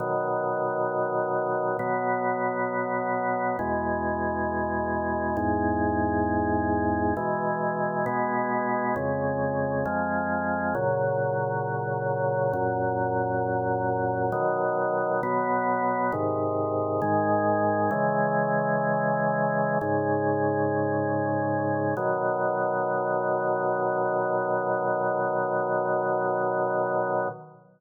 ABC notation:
X:1
M:4/4
L:1/8
Q:1/4=67
K:B
V:1 name="Drawbar Organ"
[B,,D,F,]4 [B,,F,B,]4 | [E,,B,,G,]4 [E,,G,,G,]4 | [B,,E,G,]2 [B,,G,B,]2 [^E,,C,G,]2 [E,,^E,G,]2 | [A,,C,F,]4 [F,,A,,F,]4 |
[B,,D,F,]2 [B,,F,B,]2 [G,,^B,,D,]2 [G,,D,G,]2 | "^rit." [C,E,G,]4 [G,,C,G,]4 | [B,,D,F,]8 |]